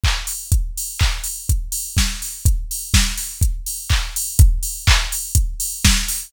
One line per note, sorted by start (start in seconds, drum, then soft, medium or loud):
0.04 kick medium
0.04 clap medium
0.27 open hi-hat medium
0.52 kick medium
0.52 closed hi-hat medium
0.78 open hi-hat medium
0.99 kick medium
0.99 clap medium
1.24 open hi-hat medium
1.49 kick medium
1.49 closed hi-hat medium
1.72 open hi-hat medium
1.97 kick medium
1.97 snare medium
2.22 open hi-hat soft
2.45 kick medium
2.45 closed hi-hat medium
2.71 open hi-hat medium
2.94 kick medium
2.94 snare medium
3.17 open hi-hat medium
3.41 kick medium
3.41 closed hi-hat medium
3.66 open hi-hat medium
3.90 kick medium
3.90 clap medium
4.16 open hi-hat medium
4.39 kick medium
4.39 closed hi-hat medium
4.63 open hi-hat medium
4.87 kick medium
4.87 clap medium
5.12 open hi-hat medium
5.35 kick medium
5.35 closed hi-hat medium
5.60 open hi-hat medium
5.85 kick medium
5.85 snare medium
6.08 open hi-hat medium